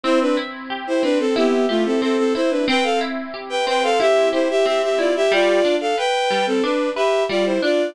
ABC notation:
X:1
M:4/4
L:1/16
Q:1/4=91
K:C
V:1 name="Violin"
[Ec] [DB] z3 [Ec] [DB] [CA] [B,G]2 [A,F] [CA] [CA] [CA] [Ec] [DB] | [Bg] [Af] z3 [Bg] [Bg] [Af] [Ge]2 [Ec] [Ge] [Ge] [Ge] [Fd] [Ge] | [Fd]3 [Af] [Bg]3 [CA] [DB]2 [Ge]2 [Fd] [Ec] [Fd]2 |]
V:2 name="Orchestral Harp"
C2 E2 G2 C2 E2 G2 C2 E2 | C2 E2 G2 C2 E2 G2 C2 E2 | G,2 D2 B2 G,2 D2 B2 G,2 D2 |]